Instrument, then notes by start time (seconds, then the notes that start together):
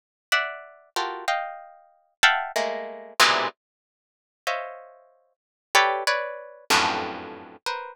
orchestral harp
0.32 D5 E5 F#5
0.96 F4 F#4 G4 A4 A#4
1.28 D#5 F5 G5
2.23 E5 F5 F#5 G5 A5 B5
2.56 G#3 A3 A#3
3.20 G#2 A#2 B2 C3 D3 E3
4.47 C5 C#5 D#5 E5 F5
5.75 G4 A4 B4 C#5 D5
6.07 B4 C#5 D5
6.70 F2 F#2 G2 A2
7.66 A#4 B4 C5